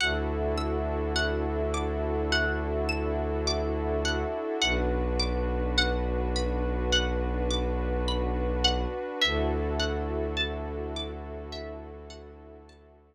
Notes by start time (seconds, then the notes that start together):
0.00 D2 D4 E4 F#4 A4 F#5
0.57 E6
1.16 F#5
1.74 D6
2.32 F#5
2.89 E6
3.47 D6
4.05 F#5
4.62 B1 D4 F#4 B4 F#5
5.19 D6
5.78 F#5
6.36 B5
6.93 F#5
7.50 D6
8.08 B5
8.64 F#5
9.21 D2 D4 E4 F#4 A4 E5
9.80 F#5
10.37 A5
10.96 D6
11.52 E5
12.10 F#5
12.69 A5